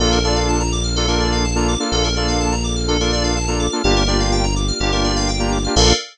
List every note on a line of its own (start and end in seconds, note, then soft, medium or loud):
0.00 1.77 A#1 medium
0.00 0.19 A#3 loud
0.00 3.80 A#3 medium
0.00 0.19 D4 loud
0.00 3.80 D4 medium
0.00 0.19 F4 loud
0.00 3.80 F4 medium
0.00 0.11 A4 loud
0.00 0.19 A4 loud
0.00 3.80 A4 medium
0.12 0.23 A#4 medium
0.24 0.63 A#3 medium
0.24 0.63 D4 loud
0.24 0.63 F4 loud
0.24 0.63 A4 loud
0.24 0.35 D5 medium
0.36 0.47 F5 medium
0.48 0.59 A5 medium
0.60 0.71 A#5 medium
0.72 0.83 D6 medium
0.84 0.95 F6 medium
0.96 1.06 A#3 loud
0.96 1.06 D4 loud
0.96 1.06 F4 loud
0.96 1.07 A4 medium
0.96 1.06 A4 loud
1.07 1.46 A#3 loud
1.07 1.46 D4 loud
1.07 1.46 F4 loud
1.07 1.46 A4 loud
1.07 1.19 A#4 medium
1.20 1.31 D5 medium
1.32 1.43 F5 medium
1.44 1.55 A5 medium
1.55 1.75 A#3 loud
1.55 1.75 D4 medium
1.55 1.75 F4 loud
1.55 1.75 A4 medium
1.55 1.67 A#5 medium
1.68 1.79 D6 medium
1.80 2.08 A#3 loud
1.80 2.08 D4 medium
1.80 2.08 F4 loud
1.80 2.08 A4 medium
1.80 1.91 F6 medium
1.92 3.69 A#1 medium
1.92 2.03 A4 loud
2.04 2.15 A#4 medium
2.16 2.55 A#3 medium
2.16 2.55 D4 medium
2.16 2.55 F4 medium
2.16 2.55 A4 loud
2.16 2.27 D5 medium
2.28 2.39 F5 medium
2.40 2.51 A5 medium
2.52 2.63 A#5 medium
2.64 2.75 D6 medium
2.76 2.87 F6 medium
2.88 2.97 A#3 loud
2.88 2.97 D4 loud
2.88 2.97 F4 medium
2.88 2.97 A4 medium
2.88 2.99 A4 medium
3.00 3.39 A#3 medium
3.00 3.39 D4 loud
3.00 3.39 F4 loud
3.00 3.39 A4 loud
3.00 3.11 A#4 medium
3.12 3.23 D5 medium
3.24 3.34 F5 medium
3.36 3.47 A5 medium
3.48 3.67 A#3 medium
3.48 3.67 D4 medium
3.48 3.67 F4 medium
3.48 3.67 A4 loud
3.48 3.58 A#5 medium
3.60 3.70 D6 medium
3.72 3.82 A#3 medium
3.72 3.82 D4 loud
3.72 3.82 F4 loud
3.72 3.82 A4 loud
3.72 3.83 F6 medium
3.82 4.72 G1 medium
3.82 5.72 A#3 medium
3.82 4.03 A#3 loud
3.82 5.72 D4 medium
3.82 4.03 D4 loud
3.82 5.72 F4 medium
3.82 4.03 F4 loud
3.82 5.72 G4 medium
3.82 3.95 G4 loud
3.82 4.03 G4 loud
3.96 4.07 A#4 medium
4.07 4.46 A#3 loud
4.07 4.46 D4 loud
4.07 4.46 F4 medium
4.07 4.46 G4 loud
4.07 4.19 D5 medium
4.20 4.31 F5 medium
4.32 4.43 G5 medium
4.44 4.55 A#5 medium
4.56 4.67 D6 medium
4.68 4.79 F6 medium
4.80 5.68 G1 medium
4.80 4.91 A#3 loud
4.80 4.91 D4 medium
4.80 4.91 F4 medium
4.80 4.91 G4 medium
4.80 4.91 G4 loud
4.92 5.31 A#3 medium
4.92 5.31 D4 loud
4.92 5.31 F4 loud
4.92 5.31 G4 medium
4.92 5.03 A#4 medium
5.04 5.15 D5 medium
5.16 5.27 F5 loud
5.28 5.39 G5 medium
5.39 5.58 A#3 loud
5.39 5.58 D4 medium
5.39 5.58 F4 medium
5.39 5.58 G4 loud
5.39 5.51 A#5 medium
5.52 5.63 D6 medium
5.64 5.75 A#3 medium
5.64 5.75 D4 loud
5.64 5.75 F4 loud
5.64 5.75 G4 loud
5.64 5.75 F6 medium
5.75 5.93 A#1 loud
5.75 5.92 A#3 loud
5.75 5.93 A#3 loud
5.75 5.92 D4 medium
5.75 5.93 D4 loud
5.75 5.92 F4 loud
5.75 5.93 F4 loud
5.75 5.92 A4 loud
5.75 5.93 A4 loud
5.75 5.93 A#4 loud
5.75 5.93 D5 medium
5.75 5.93 F5 loud